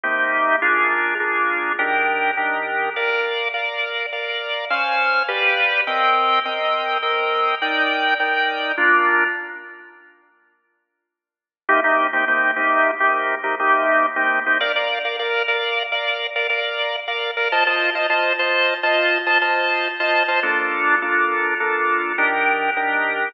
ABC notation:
X:1
M:5/4
L:1/16
Q:1/4=103
K:Bb
V:1 name="Drawbar Organ"
[C,B,EG]4 [B,DF_A]4 [B,DFA]4 [E,DGB]4 [E,DGB]4 | [Bdf]4 [Bdf]4 [Bdf]4 [_Dcf_a]4 [G=B=df]4 | [CBeg]4 [CBeg]4 [CBeg]4 [EBdg]4 [EBdg]4 | [B,DF]20 |
[C,B,EG] [C,B,EG]2 [C,B,EG] [C,B,EG]2 [C,B,EG]3 [C,B,EG]3 [C,B,EG] [C,B,EG]4 [C,B,EG]2 [C,B,EG] | [Bdf] [Bdf]2 [Bdf] [Bdf]2 [Bdf]3 [Bdf]3 [Bdf] [Bdf]4 [Bdf]2 [Bdf] | [Fcea] [Fcea]2 [Fcea] [Fcea]2 [Fcea]3 [Fcea]3 [Fcea] [Fcea]4 [Fcea]2 [Fcea] | [B,DFA]4 [B,DFA]4 [B,DFA]4 [E,DGB]4 [E,DGB]4 |]